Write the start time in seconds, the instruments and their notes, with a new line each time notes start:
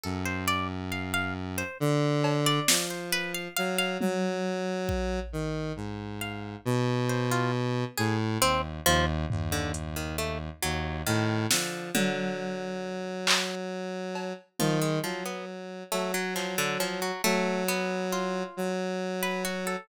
0.03 lead 1 (square) F#2, pizzicato strings A4
0.25 pizzicato strings C5
0.48 pizzicato strings D5
0.92 pizzicato strings F5
1.14 pizzicato strings F5
1.58 pizzicato strings C5
1.80 lead 1 (square) D3
2.24 cowbell
2.46 pizzicato strings D5
2.68 lead 1 (square) F3, snare
2.90 pizzicato strings C5
3.12 pizzicato strings B4
3.34 pizzicato strings F5
3.56 lead 1 (square) F#3, pizzicato strings F5
3.78 pizzicato strings F5
4.00 lead 1 (square) F#3, high tom
4.89 kick
5.33 lead 1 (square) D#3
5.76 lead 1 (square) G#2
6.21 pizzicato strings F5
6.65 lead 1 (square) B2
7.09 pizzicato strings C5
7.31 pizzicato strings F4
7.97 lead 1 (square) A2, pizzicato strings G#4
8.41 lead 1 (square) D#2, pizzicato strings C4, closed hi-hat
8.86 lead 1 (square) D#2, pizzicato strings F3
9.30 lead 1 (square) D#2, floor tom
9.52 pizzicato strings D3
9.74 closed hi-hat
9.96 pizzicato strings D#3
10.18 pizzicato strings A3
10.63 lead 1 (square) D#2, pizzicato strings F#3
11.06 lead 1 (square) A2, pizzicato strings D#3
11.51 pizzicato strings D3, lead 1 (square) F3, snare
11.94 pizzicato strings D3, lead 1 (square) F#3, high tom
13.27 clap
14.15 cowbell
14.59 lead 1 (square) D#3, pizzicato strings F3, high tom
14.81 pizzicato strings G#3
15.03 pizzicato strings F3, lead 1 (square) F#3
15.26 pizzicato strings B3
15.92 lead 1 (square) F#3, pizzicato strings A3, cowbell
16.14 pizzicato strings F#3
16.36 pizzicato strings F3, clap
16.58 pizzicato strings D3
16.80 pizzicato strings F3, cowbell
17.02 pizzicato strings F#3
17.24 lead 1 (square) F#3, pizzicato strings A3
17.68 pizzicato strings B3
18.12 pizzicato strings F4
18.57 lead 1 (square) F#3
19.23 pizzicato strings B4
19.45 pizzicato strings F#4
19.67 pizzicato strings A4